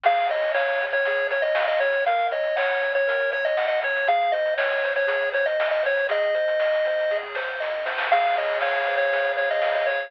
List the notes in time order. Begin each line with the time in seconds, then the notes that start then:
0.04 C#2 G#4 F5, kick, crash
0.16 kick, closed hi-hat
0.29 C#3 C#5 D#5, closed hi-hat
0.42 closed hi-hat
0.54 C#2 C#5 F5, snare
0.68 closed hi-hat
0.79 C#3 C#5, closed hi-hat
0.93 C#5, closed hi-hat
1.04 C#2 G#4, kick, closed hi-hat
1.17 closed hi-hat
1.30 C#3 C#5, closed hi-hat
1.42 D#5, closed hi-hat
1.55 C#2 F5, snare
1.68 D#5, closed hi-hat
1.80 C#3 C#5, kick, closed hi-hat
1.92 closed hi-hat
2.05 F#2 A#4 F5, kick, closed hi-hat
2.18 kick, closed hi-hat
2.31 F#3 C#5 D#5, closed hi-hat
2.44 closed hi-hat
2.56 F#2 C#5 F#5, snare
2.70 closed hi-hat
2.82 F#3 C#5, closed hi-hat
2.95 C#5, closed hi-hat
3.07 F#2 A#4, kick, closed hi-hat
3.20 closed hi-hat
3.32 F#3 C#5, closed hi-hat
3.45 D#5, closed hi-hat
3.57 F#2 F#5, snare
3.68 D#5, closed hi-hat
3.81 F#3 C#5, kick, closed hi-hat
3.96 closed hi-hat
4.07 G#1 G#4 F5, kick, closed hi-hat
4.21 kick, closed hi-hat
4.32 G#2 C5 D#5, closed hi-hat
4.46 closed hi-hat
4.57 G#1 C#5 D#5, snare
4.72 closed hi-hat
4.83 G#2 C5, closed hi-hat
4.96 C#5, closed hi-hat
5.07 G#1 G#4, kick, closed hi-hat
5.21 closed hi-hat
5.32 G#2 C5 C#5, closed hi-hat
5.46 D#5, closed hi-hat
5.59 G#1 D#5, snare
5.71 D#5, closed hi-hat
5.83 G#2 C5 C#5, kick, closed hi-hat
5.97 closed hi-hat
6.09 G#1 G#4 D#5, kick, closed hi-hat
6.22 kick, closed hi-hat
6.35 G#2 C5, closed hi-hat
6.48 closed hi-hat
6.60 G#1 D#5, snare
6.74 closed hi-hat
6.85 G#2 C5, closed hi-hat
6.99 closed hi-hat
7.10 G#1 G#4, kick, snare
7.23 high tom
7.34 G#2 C5, snare
7.47 mid tom
7.60 G#1 D#5, snare
7.72 floor tom
7.86 G#2 C5, snare
7.98 snare
8.11 C#2 G#4 F5, kick, crash
8.23 kick, closed hi-hat
8.36 C#3 C#5 D#5, closed hi-hat
8.48 closed hi-hat
8.61 C#2 C#5 F5, snare
8.76 closed hi-hat
8.85 C#3 C5, closed hi-hat
8.97 C#5, closed hi-hat
9.12 C#2 G#4, kick, closed hi-hat
9.24 closed hi-hat
9.36 C#3 C#5, closed hi-hat
9.51 D#5, closed hi-hat
9.62 C#2 F5, snare
9.75 D#5, closed hi-hat
9.86 C#3 C#5, kick, closed hi-hat
10.00 closed hi-hat